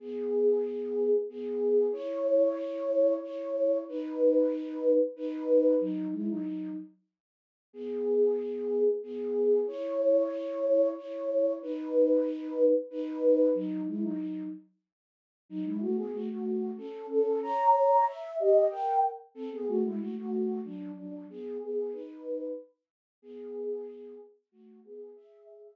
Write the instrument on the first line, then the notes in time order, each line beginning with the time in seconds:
flute
0.00 B3 G#4
1.30 B3 G#4
1.93 E4 C#5
3.22 E4 C#5
3.88 D#4 B4
5.16 D#4 B4
5.80 F#3 D#4
6.12 G#3 E4
6.29 F#3 D#4
7.73 B3 G#4
9.03 B3 G#4
9.67 E4 C#5
10.97 E4 C#5
11.62 D#4 B4
12.90 D#4 B4
13.54 F#3 D#4
13.87 G#3 E4
14.02 F#3 D#4
15.49 F#3 D#4
15.65 G#3 E4
15.81 A3 F#4
15.97 B3 G#4
16.13 A3 F#4
16.29 A3 F#4
16.77 C#4 A4
17.10 C#4 A4
17.42 C#5 A#5
18.07 E5
18.39 G4 D#5
18.71 A#4 G5
19.35 C4 A4
19.52 B3 G#4
19.68 A3 F#4
19.84 G#3 E4
20.00 A3 F#4
20.17 A3 F#4
20.65 F#3 D4
20.96 F#3 D4
21.30 B3 G#4
21.61 B3 G#4
21.92 D#4 B4
23.22 B3 G#4
24.52 A3 F#4
24.85 B3 G#4
25.16 G#4 E5
25.64 G#4 E5